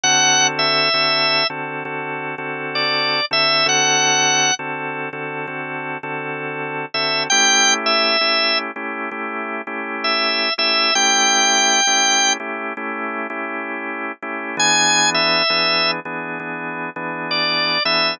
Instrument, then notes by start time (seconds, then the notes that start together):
drawbar organ
0.03 D3 C4 F#4 A4 F#5
0.59 E5
0.94 D3 C4 F#4 A4
1.50 D3 C4 F#4 A4
1.85 D3 C4 F#4 A4
2.38 D3 C4 F#4 A4
2.75 D5
3.31 D3 C4 F#4 A4 E5
3.66 D3 C4 F#4 A4 F#5
4.59 D3 C4 F#4 A4
5.13 D3 C4 F#4 A4
5.47 D3 C4 F#4 A4
6.03 D3 C4 F#4 A4
6.94 D3 C4 F#4 A4 E5
7.30 A3 C#4 E4 G4 G5
7.86 E5
8.21 A3 C#4 E4 G4
8.76 A3 C#4 E4 G4
9.11 A3 C#4 E4 G4
9.67 A3 C#4 E4 G4
10.04 E5
10.58 A3 C#4 E4 G4 E5
10.95 A3 C#4 E4 G4 G5
11.87 A3 C#4 E4 G4
12.40 A3 C#4 E4 G4
12.77 A3 C#4 E4 G4
13.30 A3 C#4 E4 G4
14.22 A3 C#4 E4 G4
14.57 E3 B3 D4 G#4 G#5
15.14 E5
15.50 E3 B3 D4 G#4
16.05 E3 B3 D4 G#4
16.40 E3 B3 D4 G#4
16.96 E3 B3 D4 G#4
17.31 D5
17.85 E3 B3 D4 G#4 E5